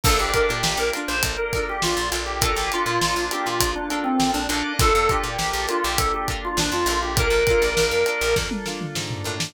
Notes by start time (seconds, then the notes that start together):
0.04 A#1 A#3 D4 F4 A4 A#4, kick, crash
0.19 A#1 G4
0.33 D4 F4 A4 A#4, kick, closed hi-hat
0.49 A#2 G4, snare
0.63 A#1, snare
0.77 A#1 A#4
0.93 D4 F4 A4 A#4, closed hi-hat
1.08 A#1 C5
1.23 A#1, kick, closed hi-hat
1.37 A#4
1.53 F4 A4 A#4, kick, snare, closed hi-hat
1.57 D4
1.69 G4
1.82 A#1 F4, snare
1.97 A#1
2.12 A#1 D4 F4 A4 A#4, snare, closed hi-hat
2.26 G4
2.41 A#3 D4 F4 A4 A#4, kick, closed hi-hat
2.56 A#1 G4
2.72 D4 F4 A4 A#4, closed hi-hat
2.86 A#2
3.01 A#1, snare
3.16 A#1
3.31 D4 F4 G4 A4 A#4, closed hi-hat
3.46 A#2 F4, snare
3.61 A#1, kick, closed hi-hat
3.76 D4
3.90 D4 F4 A4 A#4, closed hi-hat
4.04 C4
4.20 A#1, snare
4.34 A#1 D4
4.49 A#1 A#3 D4 F4 A4 A#4, closed hi-hat
4.53 D4 F4
4.79 A#1 D4 F4 A4 A#4, kick, closed hi-hat
4.95 F2
5.09 D4 F4 G4 A4 A#4, kick, closed hi-hat
5.24 A#2 G4
5.38 A#1, snare
5.53 A#1
5.67 D4 F4 A4 A#4, closed hi-hat
5.84 A#1 G4
5.98 A#1 A4, kick, closed hi-hat
6.14 G4
6.28 D4 F4 A4 A#4, kick, closed hi-hat
6.45 F4
6.57 A#1 D4, snare
6.72 F2 F4, snare
6.86 A#1 F4 A4 A#4, snare, closed hi-hat
6.91 D4
7.03 G4
7.17 A#3 D4 F4 A4 A#4, kick, closed hi-hat
7.30 A#1
7.47 F4 A4 A#4, kick, closed hi-hat
7.51 D4
7.62 A#1
7.77 A#1, snare
7.91 F2
8.06 D4 F4 A4 A#4, closed hi-hat
8.21 A#1
8.36 F2, kick, snare
8.51 high tom
8.66 D4 F4 A4 A#4, snare
8.81 mid tom
8.95 G#2, snare
9.11 floor tom
9.24 A2 D4 F4 A4 A#4
9.40 snare